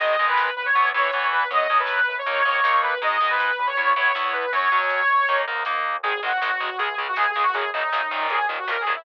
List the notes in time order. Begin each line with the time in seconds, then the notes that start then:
0.00 G#1 D#3 G#3 D#5, kick, crash
0.10 kick
0.19 C#2 D#3 G#3, kick, closed hi-hat
0.28 B4, kick
0.37 kick, snare
0.47 kick
0.56 G#1 B4, kick, closed hi-hat
0.65 C#5, kick
0.75 E2 E3 B3, kick, closed hi-hat
0.84 kick
0.94 A2 E3 B3 C#5, kick, closed hi-hat
1.05 kick
1.12 E3 B3, kick, closed hi-hat
1.22 kick
1.31 E2 B4, kick, closed hi-hat
1.41 kick
1.50 F#2 F#3 C#4 D#5, kick, closed hi-hat
1.60 kick
1.69 B2 F#3 C#4, kick, closed hi-hat
1.80 B4, kick
1.87 kick, snare
1.97 kick
2.06 F#2 B4, kick, closed hi-hat
2.17 C#5, kick
2.26 D#2 A#3 D#4, kick, closed hi-hat
2.36 kick
2.45 G#2 A#3 D#4 C#5, kick, closed hi-hat
2.54 kick
2.64 A#3 D#4, kick, snare
2.74 kick
2.82 D#2 B4, kick, closed hi-hat
2.92 kick
3.01 G#1 G#3 D#4 D#5, kick, closed hi-hat
3.11 kick
3.21 C#2 G#3 D#4, kick, closed hi-hat
3.29 B4, kick
3.40 kick, snare
3.49 kick
3.57 E2 B4, kick, closed hi-hat
3.66 C#5, kick
3.76 B3 E4, kick, closed hi-hat
3.87 kick
3.95 A2 B3 E4 C#5, kick, closed hi-hat
4.06 kick
4.15 B3 E4, kick, snare
4.24 kick
4.32 E2 B4, kick, closed hi-hat
4.42 kick
4.52 F#2 F#3 C#4 C#5, kick, closed hi-hat
4.61 kick
4.72 B2 F#3 C#4, kick, closed hi-hat
4.82 kick
4.89 kick, snare
5.01 kick
5.09 F#2, kick, closed hi-hat
5.18 kick
5.28 D#2 A#3 D#4, kick, closed hi-hat
5.39 kick
5.46 G#2 A#3 D#4, kick, closed hi-hat
5.56 kick
5.65 A#3 D#4, kick, snare
5.74 kick
5.84 D#2, kick, closed hi-hat
5.95 kick
6.03 G#1 D#3 G#3 G#4, kick, closed hi-hat
6.14 kick
6.23 G#1 D#3 G#3 F#4, kick, closed hi-hat
6.32 kick
6.42 G#1 D#3 G#3, kick, snare
6.51 kick
6.60 G#1 D#3 G#3, kick, closed hi-hat
6.69 kick
6.78 C#2 C#3 G#3 G#4, kick, closed hi-hat
6.88 kick
6.97 C#2 C#3 G#3, kick, closed hi-hat
7.07 F#4, kick
7.16 C#2 C#3 G#3 G#4, kick, snare
7.28 G#4, kick
7.35 C#2 C#3 G#3, kick, closed hi-hat
7.42 F#4, kick
7.53 F#2 C#3 F#3 G#4, kick, closed hi-hat
7.63 kick
7.73 F#2 C#3 F#3 D#4, kick, closed hi-hat
7.83 kick
7.92 F#2 C#3 F#3, kick, snare
8.01 kick
8.11 F#2 A#2 D#3, kick, closed hi-hat
8.20 kick
8.30 D#2 G#4, kick, closed hi-hat
8.39 kick
8.49 D#2 A#2 D#3, kick, closed hi-hat
8.58 F#4, kick
8.68 D#2 A#2 D#3 A#4, kick, snare
8.77 G#4, kick
8.85 D#2 A#2 D#3, kick, closed hi-hat
8.95 E4, kick